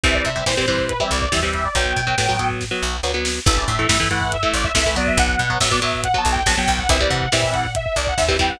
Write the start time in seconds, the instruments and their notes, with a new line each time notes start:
0.03 electric bass (finger) C2, overdriven guitar E3 G3 C4, lead 2 (sawtooth) E5, kick, closed hi-hat
0.14 lead 2 (sawtooth) D5, kick
0.25 electric bass (finger) C3, lead 2 (sawtooth) E5, kick, closed hi-hat
0.36 overdriven guitar E3 G3 C4, kick
0.46 electric bass (finger) A#2, overdriven guitar E3 G3 C4, lead 2 (sawtooth) C5, kick, snare
0.57 overdriven guitar E3 G3 C4, kick
0.68 overdriven guitar E3 G3 C4, lead 2 (sawtooth) C5, kick, closed hi-hat
0.78 kick
0.89 lead 2 (sawtooth) B4, kick, closed hi-hat
1.00 overdriven guitar E3 G3 C4, lead 2 (sawtooth) E5, kick
1.11 electric bass (finger) C2, lead 2 (sawtooth) D5, kick, closed hi-hat
1.22 lead 2 (sawtooth) D5, kick
1.32 electric bass (finger) D#2, overdriven guitar E3 G3 C4, lead 2 (sawtooth) E5, kick, snare
1.43 overdriven guitar E3 G3 C4, kick
1.53 lead 2 (sawtooth) E5, kick, closed hi-hat
1.64 lead 2 (sawtooth) D5, kick
1.75 electric bass (finger) B1, overdriven guitar F#3 B3, lead 2 (sawtooth) G5, kick, closed hi-hat
1.86 kick
1.96 electric bass (finger) B2, kick, closed hi-hat
2.07 overdriven guitar F#3 B3, kick
2.18 electric bass (finger) A2, overdriven guitar F#3 B3, kick, snare
2.29 overdriven guitar F#3 B3, kick
2.39 overdriven guitar F#3 B3, kick, closed hi-hat
2.50 kick
2.61 kick, snare
2.71 overdriven guitar F#3 B3
2.82 electric bass (finger) B1
3.03 electric bass (finger) D2, overdriven guitar F#3 B3
3.14 overdriven guitar F#3 B3
3.25 snare
3.46 electric bass (finger) A1, overdriven guitar E3 A3, lead 2 (sawtooth) E5, kick, crash
3.57 lead 2 (sawtooth) D5, kick
3.68 electric bass (finger) A2, lead 2 (sawtooth) E5, kick, closed hi-hat
3.79 overdriven guitar E3 A3, kick
3.89 electric bass (finger) G2, overdriven guitar E3 A3, lead 2 (sawtooth) E5, kick, snare
4.00 overdriven guitar E3 A3, kick
4.11 overdriven guitar E3 A3, lead 2 (sawtooth) F#5, kick, closed hi-hat
4.21 kick
4.32 lead 2 (sawtooth) E5, kick, closed hi-hat
4.43 overdriven guitar E3 A3, lead 2 (sawtooth) E5, kick
4.54 electric bass (finger) A1, lead 2 (sawtooth) D5, kick, closed hi-hat
4.64 lead 2 (sawtooth) E5, kick
4.75 electric bass (finger) C2, overdriven guitar E3 A3, lead 2 (sawtooth) E5, kick, snare
4.86 overdriven guitar E3 A3, kick
4.96 overdriven guitar F#3 B3, lead 2 (sawtooth) D5, kick, closed hi-hat
5.07 lead 2 (sawtooth) E5, kick
5.17 electric bass (finger) B1, lead 2 (sawtooth) F#5, kick, closed hi-hat
5.28 kick
5.39 electric bass (finger) B2, kick, closed hi-hat
5.50 overdriven guitar F#3 B3, kick
5.60 electric bass (finger) A2, overdriven guitar F#3 B3, lead 2 (sawtooth) E5, kick, snare
5.71 overdriven guitar F#3 B3, lead 2 (sawtooth) D5, kick
5.82 overdriven guitar F#3 B3, lead 2 (sawtooth) E5, kick, closed hi-hat
5.93 kick
6.04 lead 2 (sawtooth) F#5, kick, closed hi-hat
6.14 overdriven guitar F#3 B3, lead 2 (sawtooth) A5, kick
6.25 electric bass (finger) B1, kick, closed hi-hat
6.32 lead 2 (sawtooth) G5, kick
6.46 electric bass (finger) A#1, overdriven guitar F#3 B3, lead 2 (sawtooth) A5, kick, snare
6.57 overdriven guitar F#3 B3, lead 2 (sawtooth) G5, kick
6.68 electric bass (finger) B1, lead 2 (sawtooth) G5, kick, open hi-hat
6.78 lead 2 (sawtooth) F#5, kick
6.89 electric bass (finger) C2, overdriven guitar E3 G3 C4, lead 2 (sawtooth) E5, kick, closed hi-hat
7.00 overdriven guitar E3 G3 C4, lead 2 (sawtooth) D5, kick
7.10 electric bass (finger) C3, lead 2 (sawtooth) F#5, kick, closed hi-hat
7.21 kick
7.32 electric bass (finger) A#2, overdriven guitar E3 G3 C4, lead 2 (sawtooth) E5, kick, snare
7.43 kick
7.53 lead 2 (sawtooth) F#5, kick, closed hi-hat
7.64 kick
7.75 lead 2 (sawtooth) E5, kick, closed hi-hat
7.85 lead 2 (sawtooth) E5, kick
7.96 electric bass (finger) C2, lead 2 (sawtooth) D5, kick, closed hi-hat
8.07 lead 2 (sawtooth) F#5, kick
8.17 electric bass (finger) D#2, lead 2 (sawtooth) E5, kick, snare
8.28 overdriven guitar E3 G3 C4, kick
8.39 overdriven guitar E3 G3 C4, lead 2 (sawtooth) G5, kick, open hi-hat
8.49 lead 2 (sawtooth) F#5, kick